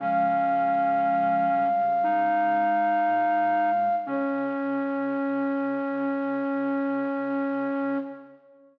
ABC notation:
X:1
M:4/4
L:1/8
Q:1/4=59
K:Db
V:1 name="Flute"
f8 | d8 |]
V:2 name="Flute"
D4 E4 | D8 |]
V:3 name="Flute"
[F,A,]3 =G, A,4 | D8 |]
V:4 name="Flute" clef=bass
D,6 B,,2 | D,8 |]